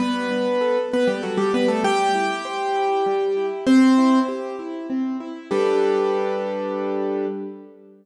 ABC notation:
X:1
M:3/4
L:1/16
Q:1/4=98
K:G
V:1 name="Acoustic Grand Piano"
[B,B]6 [B,B] [G,G] [F,F] [G,G] [B,B] [A,A] | [Gg]12 | [Cc]4 z8 | G12 |]
V:2 name="Acoustic Grand Piano"
G,2 D2 A2 B2 A2 D2 | G,2 E2 c2 E2 G,2 E2 | z2 E2 G2 E2 C2 E2 | [G,DAB]12 |]